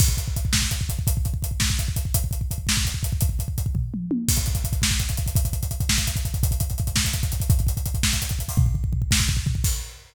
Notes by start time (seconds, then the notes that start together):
0.00 kick, crash
0.08 kick
0.17 kick, closed hi-hat
0.28 kick
0.36 kick, closed hi-hat
0.45 kick
0.53 kick, snare
0.62 kick
0.71 kick, closed hi-hat
0.81 kick
0.89 kick, closed hi-hat
0.99 kick
1.07 kick, closed hi-hat
1.17 kick
1.25 kick, closed hi-hat
1.34 kick
1.42 kick, closed hi-hat
1.51 kick
1.60 kick, snare
1.70 kick
1.79 kick, closed hi-hat
1.88 kick
1.96 kick, closed hi-hat
2.05 kick
2.14 kick, closed hi-hat
2.24 kick
2.31 kick, closed hi-hat
2.41 kick
2.51 kick, closed hi-hat
2.58 kick
2.67 kick, snare
2.77 kick
2.85 kick, closed hi-hat
2.94 kick
3.03 kick, closed hi-hat
3.13 kick
3.21 kick, closed hi-hat
3.29 kick
3.39 kick, closed hi-hat
3.48 kick
3.58 kick, closed hi-hat
3.66 kick
3.75 kick, floor tom
3.94 mid tom
4.11 high tom
4.28 kick, crash
4.36 kick, closed hi-hat
4.46 kick, closed hi-hat
4.55 kick, closed hi-hat
4.64 kick, closed hi-hat
4.73 kick, closed hi-hat
4.82 kick, snare
4.91 kick
4.99 kick, closed hi-hat
5.09 kick, closed hi-hat
5.17 kick, closed hi-hat
5.26 kick, closed hi-hat
5.35 kick, closed hi-hat
5.45 kick, closed hi-hat
5.53 kick, closed hi-hat
5.63 kick, closed hi-hat
5.71 kick, closed hi-hat
5.80 kick, closed hi-hat
5.89 kick, snare
5.98 kick, closed hi-hat
6.07 kick, closed hi-hat
6.16 kick, closed hi-hat
6.25 kick, closed hi-hat
6.34 kick, closed hi-hat
6.43 kick, closed hi-hat
6.51 kick, closed hi-hat
6.60 kick, closed hi-hat
6.70 kick, closed hi-hat
6.78 kick, closed hi-hat
6.87 kick, closed hi-hat
6.96 kick, snare
7.05 kick, closed hi-hat
7.13 kick, closed hi-hat
7.23 kick, closed hi-hat
7.32 kick, closed hi-hat
7.40 kick, closed hi-hat
7.50 kick, closed hi-hat
7.59 kick, closed hi-hat
7.67 kick, closed hi-hat
7.77 kick, closed hi-hat
7.86 kick, closed hi-hat
7.94 kick, closed hi-hat
8.03 kick, snare
8.13 kick, closed hi-hat
8.22 kick, closed hi-hat
8.29 kick, closed hi-hat
8.39 kick, closed hi-hat
8.48 kick, open hi-hat
8.57 kick, floor tom
8.66 kick
8.74 kick, floor tom
8.84 kick
8.93 kick, floor tom
9.02 kick
9.11 kick, snare
9.20 kick
9.28 kick, floor tom
9.37 kick
9.46 kick, floor tom
9.55 kick
9.64 kick, crash